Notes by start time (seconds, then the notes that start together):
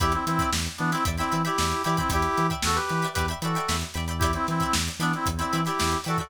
0.00 E2 E4 G4 D5 E5 G5 B5, kick, closed hi-hat
0.12 C4 E4, closed hi-hat
0.26 E3 C4 E4, closed hi-hat
0.39 D5 E5 G5 B5, kick, closed hi-hat
0.53 E2, snare
0.66 closed hi-hat
0.78 E3 B3 D4, closed hi-hat
0.92 C4 E4 D5 E5 G5 B5, snare, closed hi-hat
1.05 E2 D5 E5 G5 B5, kick, closed hi-hat
1.17 C4 E4 D5 E5 G5 B5, snare, closed hi-hat
1.32 E3 D5 E5 G5 B5, closed hi-hat
1.45 E4 G4 D5 E5 G5 B5, closed hi-hat
1.58 E2 D5 E5 G5 B5, snare
1.71 snare, closed hi-hat
1.84 E3 E4 G4 D5 E5 G5 B5, closed hi-hat
1.97 C4 E4 D5 E5 G5 B5, kick, closed hi-hat
2.10 E2 E4 G4 D5 E5 G5 B5, kick, closed hi-hat
2.22 closed hi-hat
2.38 E3, closed hi-hat
2.50 D5 E5 G5 B5, kick, closed hi-hat
2.63 E2 F#4 A4, snare
2.75 G4 B4, closed hi-hat
2.89 E3, snare, closed hi-hat
3.02 D5 E5 G5 B5, closed hi-hat
3.14 G4 B4 G5 B5, kick, closed hi-hat
3.18 E2 D5 E5
3.28 D5 E5 G5 B5, closed hi-hat
3.42 E3 F#4 A4 D5 E5 G5 B5, closed hi-hat
3.55 D5 E5 G5 B5, closed hi-hat
3.68 E2 D5 E5 G5 B5, snare
3.81 closed hi-hat
3.94 E2 D5 E5 G5 B5, closed hi-hat
4.08 D5 E5 G5 B5, closed hi-hat
4.19 E4 G4 G5 B5, kick, closed hi-hat
4.23 D5 E5
4.33 C4 E4, closed hi-hat
4.47 E3 C4 E4, snare, closed hi-hat
4.60 D5 E5 G5 B5, kick, closed hi-hat
4.73 E2, snare
4.88 closed hi-hat
4.99 E3 B3 D4 D5 E5 G5 B5, snare, closed hi-hat
5.13 C4 E4, closed hi-hat
5.26 E2, kick, closed hi-hat
5.37 C4 E4 G5 B5, closed hi-hat
5.41 D5 E5
5.53 E3 D5 E5 G5 B5, closed hi-hat
5.65 E4 G4 D5 E5 G5 B5, snare, closed hi-hat
5.79 E2 D5 E5 G5 B5, snare
5.92 closed hi-hat
6.04 E3 F#4 A4 D5 E5 G5 B5, closed hi-hat
6.18 F#4 A4 D5 E5 G5 B5, kick, closed hi-hat